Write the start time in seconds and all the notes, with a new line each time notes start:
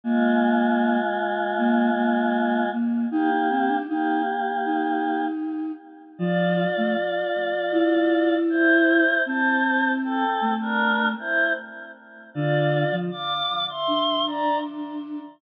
0.04 G#3 A#3 F4
1.58 A#3
1.96 A#3
2.73 A#3
3.11 A#3 D#4 G4
3.30 D#4
3.50 C4
3.68 D4
3.88 A#3 D#4 G4
4.65 D#4
6.18 F3 F4 D5
6.77 A3
7.72 E4
8.50 E4 C5
9.26 C4 C5 A5
10.04 C4 A4
10.41 A3
10.61 D4 A#4
11.19 E4 C5
12.34 D3 F4 D5
12.92 F3
13.11 F5 D6
13.69 E5 C6
13.88 D4
14.27 D5 A#5